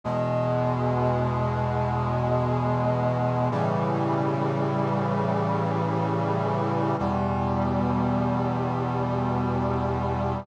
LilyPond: \new Staff { \clef bass \time 4/4 \key d \major \tempo 4 = 69 <e, b, gis>1 | <a, cis e g>1 | <e, b, g>1 | }